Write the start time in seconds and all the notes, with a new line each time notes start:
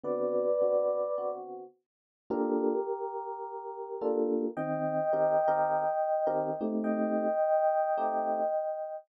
0.04 D3 B3 C4 F#4 B4 D5
0.61 D3 B3 C4 F#4
1.18 D3 B3 C4 F#4
2.30 A#3 D4 F4 G4 A4 A#4
4.01 A#3 D4 F4 A4
4.57 D#3 C4 D#5 G5
5.13 D#3 C4 G4 A#4
5.48 D#3 C4 G4 A#4
6.27 D#3 C4 G4 A#4
6.61 A3 C4 D#4 G4
6.84 D#5 G5
7.98 A3 C4 D#4 G4